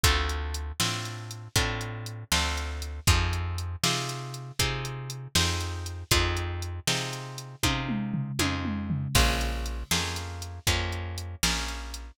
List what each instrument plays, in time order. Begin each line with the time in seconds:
0.03 electric bass (finger) D2, acoustic guitar (steel) C4 D4 F4 A4, kick, closed hi-hat
0.29 closed hi-hat
0.54 closed hi-hat
0.80 electric bass (finger) A2, acoustic guitar (steel) C4 D4 F4 A4, snare
1.05 closed hi-hat
1.31 closed hi-hat
1.56 electric bass (finger) A2, acoustic guitar (steel) C4 D4 F4 A4, kick, closed hi-hat
1.81 closed hi-hat
2.06 closed hi-hat
2.32 electric bass (finger) D2, acoustic guitar (steel) C4 D4 F4 A4, snare
2.57 closed hi-hat
2.82 closed hi-hat
3.07 electric bass (finger) F2, acoustic guitar (steel) C4 D#4 F4 G#4, kick, closed hi-hat
3.33 closed hi-hat
3.58 closed hi-hat
3.83 electric bass (finger) C3, acoustic guitar (steel) C4 D#4 F4 G#4, snare
4.09 closed hi-hat
4.34 closed hi-hat
4.59 electric bass (finger) C3, acoustic guitar (steel) C4 D#4 F4 G#4, kick, closed hi-hat
4.85 closed hi-hat
5.10 closed hi-hat
5.35 electric bass (finger) F2, acoustic guitar (steel) C4 D#4 F4 G#4, snare
5.61 closed hi-hat
5.86 closed hi-hat
6.11 electric bass (finger) F2, acoustic guitar (steel) C4 D#4 F4 G#4, kick, closed hi-hat
6.37 closed hi-hat
6.62 closed hi-hat
6.87 electric bass (finger) C3, acoustic guitar (steel) C4 D#4 F4 G#4, snare
7.13 closed hi-hat
7.38 closed hi-hat
7.63 electric bass (finger) C3, acoustic guitar (steel) C4 D#4 F4 G#4, kick, high tom
7.89 mid tom
8.14 floor tom
8.39 electric bass (finger) F2, acoustic guitar (steel) C4 D#4 F4 G#4, high tom
8.65 mid tom
8.90 floor tom
9.15 electric bass (finger) A#1, acoustic guitar (steel) A#3 C#4 F4 G#4, kick, crash
9.41 closed hi-hat
9.66 closed hi-hat
9.91 electric bass (finger) F2, acoustic guitar (steel) A#3 C#4 F4 G#4, snare
10.16 closed hi-hat
10.42 closed hi-hat
10.67 electric bass (finger) F2, acoustic guitar (steel) A#3 C#4 F4 G#4, kick, closed hi-hat
10.92 closed hi-hat
11.18 closed hi-hat
11.43 electric bass (finger) A#1, acoustic guitar (steel) A#3 C#4 F4 G#4, snare
11.68 closed hi-hat
11.94 closed hi-hat